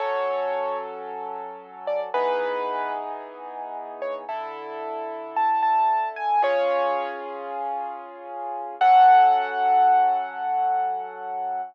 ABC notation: X:1
M:4/4
L:1/16
Q:1/4=112
K:F#m
V:1 name="Acoustic Grand Piano"
c6 z8 d z | B6 z8 c z | z8 a2 a4 g2 | "^rit." c6 z10 |
f16 |]
V:2 name="Acoustic Grand Piano"
[F,CA]16 | [E,B,^DG]16 | [D,EA]16 | "^rit." [C^EG]16 |
[F,CA]16 |]